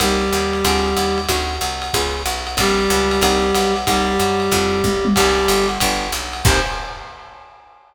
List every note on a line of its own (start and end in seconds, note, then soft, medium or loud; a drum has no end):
0.00 0.31 C2 loud
0.00 1.19 G3 medium
0.00 0.25 A#3 medium
0.00 0.25 C4 medium
0.00 0.25 D#4 medium
0.00 0.25 G4 medium
0.00 1.19 G4 medium
0.00 kick soft
0.00 ride loud
0.32 0.63 D#2 medium
0.32 hi-hat pedal medium
0.32 ride medium
0.53 ride medium
0.64 0.95 D2 loud
0.64 0.90 C4 medium
0.64 0.90 D4 medium
0.64 0.90 F4 medium
0.64 0.90 G#4 medium
0.64 kick soft
0.64 ride loud
0.96 1.27 D#2 medium
0.96 hi-hat pedal medium
0.96 ride medium
1.18 ride medium
1.29 1.59 D2 medium
1.29 1.54 C4 medium
1.29 1.54 D4 loud
1.29 1.54 D#4 medium
1.29 1.54 F#4 loud
1.29 kick soft
1.29 ride medium
1.61 1.91 C2 medium
1.61 hi-hat pedal medium
1.61 ride medium
1.82 ride medium
1.93 2.24 C#2 medium
1.93 2.20 B3 medium
1.93 2.20 C#4 medium
1.93 2.20 F4 medium
1.93 2.20 G#4 medium
1.93 kick medium
1.93 ride medium
2.26 2.56 B1 medium
2.26 hi-hat pedal medium
2.26 ride medium
2.47 ride medium
2.57 2.88 A#1 medium
2.57 3.74 G3 medium
2.57 2.82 A#3 medium
2.57 2.82 C4 medium
2.57 2.82 D4 loud
2.57 3.74 G4 medium
2.57 2.82 A4 medium
2.57 kick medium
2.57 ride loud
2.90 3.20 C#2 loud
2.90 hi-hat pedal medium
2.90 ride medium
3.11 ride medium
3.21 3.52 C2 loud
3.21 3.47 A#3 medium
3.21 3.47 C4 medium
3.21 3.47 D#4 loud
3.21 3.47 G4 medium
3.21 kick soft
3.21 ride loud
3.55 3.85 B1 medium
3.55 hi-hat pedal medium
3.55 ride medium
3.76 ride medium
3.87 4.17 C2 medium
3.87 5.06 G3 medium
3.87 4.13 A#3 medium
3.87 4.13 C4 medium
3.87 4.13 D#4 medium
3.87 4.13 G4 medium
3.87 5.06 G4 medium
3.87 kick medium
3.87 ride medium
4.19 4.50 F#2 medium
4.19 hi-hat pedal medium
4.19 ride medium
4.40 ride medium
4.51 4.82 F2 loud
4.51 4.77 A3 medium
4.51 4.77 C4 medium
4.51 4.77 E4 medium
4.51 4.77 F4 medium
4.51 kick medium
4.51 ride medium
4.84 5.14 B1 medium
4.84 kick medium
4.84 high tom medium
5.05 high tom medium
5.14 5.47 C2 loud
5.14 5.66 G3 medium
5.14 5.43 G3 medium
5.14 5.43 A#3 medium
5.14 5.43 C4 medium
5.14 5.43 D#4 medium
5.14 5.66 G4 medium
5.14 kick medium
5.14 crash loud
5.14 ride medium
5.48 5.78 G1 medium
5.48 hi-hat pedal medium
5.48 ride medium
5.69 ride medium
5.80 6.11 G1 loud
5.80 6.07 F3 medium
5.80 6.07 G3 loud
5.80 6.07 B3 medium
5.80 6.07 D4 medium
5.80 kick medium
5.80 ride loud
6.12 6.42 B1 medium
6.12 hi-hat pedal medium
6.12 ride medium
6.33 ride medium
6.44 6.59 C2 loud
6.44 6.60 A#3 medium
6.44 6.60 C4 loud
6.44 6.60 D#4 medium
6.44 6.60 G4 loud
6.44 6.58 C5 loud
6.44 kick loud
6.44 crash loud